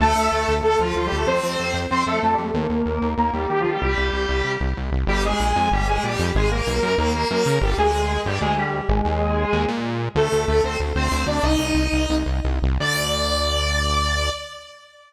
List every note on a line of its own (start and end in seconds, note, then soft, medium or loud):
0.00 0.14 D2 medium
0.00 0.53 A3 medium
0.00 0.53 A4 medium
0.15 0.29 D2 medium
0.32 0.45 D2 medium
0.48 0.61 D2 medium
0.63 0.76 D2 medium
0.63 0.78 A3 medium
0.63 0.78 A4 medium
0.79 0.93 D2 medium
0.79 0.94 F3 medium
0.79 0.94 F4 medium
0.95 1.09 D2 medium
0.95 1.05 F3 medium
0.95 1.05 F4 medium
1.06 1.16 G3 medium
1.06 1.16 G4 medium
1.12 1.26 D2 medium
1.16 1.26 A3 medium
1.16 1.26 A4 medium
1.27 1.40 F2 medium
1.27 1.78 C4 medium
1.27 1.78 C5 medium
1.43 1.57 F2 medium
1.59 1.73 F2 medium
1.74 1.87 F2 medium
1.91 2.04 F2 medium
1.91 2.04 C4 medium
1.91 2.04 C5 medium
2.06 2.20 F2 medium
2.06 2.20 A3 medium
2.06 2.20 A4 medium
2.22 2.36 F2 medium
2.22 2.32 A3 medium
2.22 2.32 A4 medium
2.32 2.42 G3 medium
2.32 2.42 G4 medium
2.38 2.52 F2 medium
2.44 2.54 A3 medium
2.44 2.54 A4 medium
2.54 2.67 D#2 medium
2.54 3.09 A#3 medium
2.54 3.09 A#4 medium
2.69 2.83 D#2 medium
2.86 2.99 D#2 medium
3.02 3.15 D#2 medium
3.18 3.31 D#2 medium
3.18 3.31 A#3 medium
3.18 3.31 A#4 medium
3.33 3.47 D#2 medium
3.33 3.48 G3 medium
3.33 3.48 G4 medium
3.50 3.63 D#2 medium
3.50 3.60 G3 medium
3.50 3.60 G4 medium
3.60 3.70 F3 medium
3.60 3.70 F4 medium
3.64 3.78 D#2 medium
3.70 3.80 G3 medium
3.70 3.80 G4 medium
3.81 3.95 C2 medium
3.81 4.52 G3 medium
3.81 4.52 G4 medium
3.97 4.11 C2 medium
4.13 4.26 C2 medium
4.29 4.42 C2 medium
4.44 4.57 C2 medium
4.60 4.74 C2 medium
4.77 4.91 C2 medium
4.91 5.05 C2 medium
5.07 5.34 G1 loud
5.07 5.23 G3 medium
5.07 5.23 G4 medium
5.24 5.69 G#3 medium
5.24 5.69 G#4 medium
5.40 5.53 A#1 medium
5.56 5.70 F2 loud
5.72 5.99 G1 loud
5.72 5.87 G3 medium
5.72 5.87 G4 medium
5.87 6.03 G#3 medium
5.87 6.03 G#4 medium
6.03 6.17 A#1 medium
6.03 6.30 G3 medium
6.03 6.30 G4 medium
6.19 6.32 F2 loud
6.35 6.62 G#1 loud
6.35 6.49 G#3 medium
6.35 6.49 G#4 medium
6.51 6.96 A#3 medium
6.51 6.96 A#4 medium
6.67 6.80 B1 loud
6.83 6.96 F#2 loud
6.98 7.25 D#2 loud
6.98 7.12 A#3 medium
6.98 7.12 A#4 medium
7.14 7.28 A#3 medium
7.14 7.28 A#4 medium
7.30 7.44 F#2 loud
7.30 7.56 A#3 medium
7.30 7.56 A#4 medium
7.46 7.59 C#3 loud
7.61 7.75 G1 loud
7.61 7.76 G3 medium
7.61 7.76 G4 medium
7.78 8.18 D2 loud
7.78 8.20 G#3 medium
7.78 8.20 G#4 medium
8.25 8.39 G1 loud
8.25 8.39 G3 medium
8.25 8.39 G4 medium
8.41 8.81 D2 loud
8.41 8.54 G#3 medium
8.41 8.54 G#4 medium
8.57 8.83 G3 medium
8.57 8.83 G4 medium
8.89 9.02 G#1 loud
8.89 9.63 G#3 medium
8.89 9.63 G#4 medium
9.05 9.46 D#2 loud
9.53 9.66 D#2 loud
9.68 10.09 A#2 loud
10.15 10.29 D2 loud
10.15 10.45 A3 medium
10.15 10.45 A4 medium
10.32 10.46 D2 medium
10.47 10.61 D2 medium
10.47 10.62 A3 medium
10.47 10.62 A4 medium
10.64 10.77 D2 medium
10.64 10.77 C4 medium
10.64 10.77 C5 medium
10.80 10.93 D2 medium
10.95 11.09 D2 medium
10.95 11.25 C4 medium
10.95 11.25 C5 medium
11.11 11.25 D2 loud
11.26 11.40 D2 medium
11.26 11.42 D4 medium
11.26 11.42 D5 medium
11.43 11.57 C2 medium
11.43 12.15 D#4 medium
11.43 12.15 D#5 medium
11.59 11.72 C2 medium
11.74 11.88 C2 medium
11.92 12.07 C2 medium
12.09 12.24 C2 medium
12.26 12.41 C2 medium
12.45 12.60 C2 medium
12.62 12.78 C2 loud
12.80 14.30 D2 loud
12.80 14.30 D5 loud